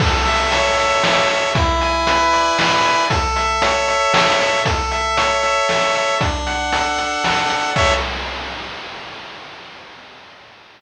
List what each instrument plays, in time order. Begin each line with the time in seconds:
0.00 lead 1 (square) A4, kick, crash
0.25 lead 1 (square) E5, closed hi-hat
0.52 lead 1 (square) C#5, closed hi-hat
0.78 lead 1 (square) E5, closed hi-hat
1.03 lead 1 (square) A4, snare
1.29 lead 1 (square) E5, closed hi-hat
1.55 lead 1 (square) E4, kick, closed hi-hat
1.81 lead 1 (square) G#5, closed hi-hat
2.07 lead 1 (square) B4, closed hi-hat
2.33 lead 1 (square) D5, closed hi-hat
2.59 lead 1 (square) E4, snare
2.85 lead 1 (square) G#5, closed hi-hat
3.10 lead 1 (square) A4, kick, closed hi-hat
3.36 lead 1 (square) E5, closed hi-hat
3.62 lead 1 (square) C#5, closed hi-hat
3.88 lead 1 (square) E5, closed hi-hat
4.13 lead 1 (square) A4, snare
4.40 lead 1 (square) E5, closed hi-hat
4.65 lead 1 (square) A4, kick, closed hi-hat
4.91 lead 1 (square) E5, closed hi-hat
5.17 lead 1 (square) C#5, closed hi-hat
5.43 lead 1 (square) E5, closed hi-hat
5.69 lead 1 (square) A4, snare
5.95 lead 1 (square) E5, closed hi-hat
6.20 lead 1 (square) D4, kick, closed hi-hat
6.46 lead 1 (square) F#5, closed hi-hat
6.73 lead 1 (square) A4, closed hi-hat
6.98 lead 1 (square) F#5, closed hi-hat
7.24 lead 1 (square) D4, snare
7.50 lead 1 (square) F#5, closed hi-hat
7.76 lead 1 (square) A4 C#5 E5, kick, crash